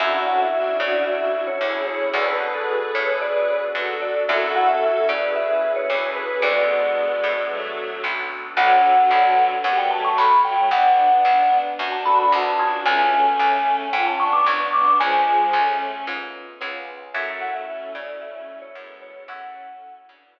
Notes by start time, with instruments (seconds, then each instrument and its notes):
0.00 electric bass (finger) F#2, electric piano 1 C#4 E4 F#4 A4, pad 2 (warm) C#4 E4 F#4 A4, violin D4 F#4, vibraphone E5
0.27 vibraphone F#5
0.40 vibraphone E5
0.54 violin D4 F#4
0.80 electric bass (finger) C#3, vibraphone D5
1.07 vibraphone E5
1.47 vibraphone C#5
1.61 electric bass (finger) D2, violin E4 G#4
1.87 vibraphone C#5
2.14 electric bass (finger) D2, electric piano 1 B3 D4 F#4 A4, pad 2 (warm) B3 D4 F#4 A4, violin G#4 B4, vibraphone D5
2.28 vibraphone B4
2.41 electric piano 1 B3 D4 F#4 A4
2.55 vibraphone A4
2.94 electric bass (finger) A2, violin G#4 B4, vibraphone C#5
3.21 vibraphone D5
3.75 electric bass (finger) F#2, violin F#4 A4
4.02 vibraphone D5
4.28 electric bass (finger) F#2, electric piano 1 C#4 E4 F#4 A4, pad 2 (warm) C#4 E4 F#4 A4, violin F#4 A4, vibraphone E5
4.55 vibraphone F#5
4.69 vibraphone E5
5.08 electric bass (finger) C#3, violin G#4 B4, vibraphone D5
5.36 vibraphone E5
5.76 vibraphone C#5
5.90 electric bass (finger) D2, violin G#4 B4
6.16 vibraphone B4
6.42 electric bass (finger) D2, violin G#3 B3, pad 2 (warm) B3 D4 F#4 A4, electric piano 1 B3 D4 F#4 A4, vibraphone D5
7.24 electric bass (finger) A2
7.50 violin F#3 A3
8.04 electric bass (finger) B1
8.57 electric bass (finger) B1, violin D3 F#3, electric piano 1 B3 D4 F#4 A4, vibraphone F#5
9.11 electric bass (finger) B1, electric piano 1 B3 D4 F#4 A4
9.64 electric bass (finger) F#2, violin G3 B3, vibraphone F#5
9.78 vibraphone G5
9.91 violin F#3 A3, vibraphone A5
10.05 vibraphone C#6
10.18 electric bass (finger) B1, vibraphone B5
10.44 violin F#3 A3, vibraphone G5
10.71 electric bass (finger) B1, violin B3 D4, vibraphone F#5
11.25 electric bass (finger) B1
11.79 electric bass (finger) F#2, violin D4 F#4
11.92 vibraphone A5
12.05 electric piano 1 B3 D4 F#4 A4, violin D4 F#4, vibraphone B5
12.19 vibraphone B5
12.32 electric bass (finger) C2, vibraphone A5
12.59 electric piano 1 B3 C#4 F4 G#4, violin D4 F#4
12.85 electric bass (finger) C#2, violin A3 C#4, vibraphone G#5
13.39 electric bass (finger) C#2
13.93 electric bass (finger) G#2, violin C#4 F4, vibraphone G5
14.06 vibraphone A5
14.19 violin B3 D4, vibraphone C#6
14.33 vibraphone D6
14.46 electric bass (finger) C#2, vibraphone C#6
14.73 violin B3 D4, vibraphone D6
15.00 electric bass (finger) C#2, violin F3 G#3, vibraphone G#5
15.53 electric bass (finger) C#2, violin A3 C#4
16.07 electric bass (finger) G#2, electric piano 1 B3 C#4 F4 G#4
16.61 electric bass (finger) C#2, electric piano 1 B3 C#4 F4 G#4
17.14 electric bass (finger) F#2, violin F#3 A3, pad 2 (warm) C#4 E4 F#4 A4, electric piano 1 C#5 E5 F#5 A5, vibraphone E5
17.41 vibraphone F#5
17.54 vibraphone E5
17.67 violin A3 C#4
17.95 electric bass (finger) C#3, vibraphone D5
18.21 vibraphone E5
18.62 vibraphone C#5
18.75 electric bass (finger) F#2, violin G#3 B3
19.02 vibraphone C#5
19.28 electric bass (finger) F#2, violin A3 C#4, pad 2 (warm) C#4 E4 F#4 A4, electric piano 1 C#5 E5 F#5 A5, vibraphone F#5
20.08 electric bass (finger) C#3, violin B3 D4
20.36 electric piano 1 C#5 E5 F#5 A5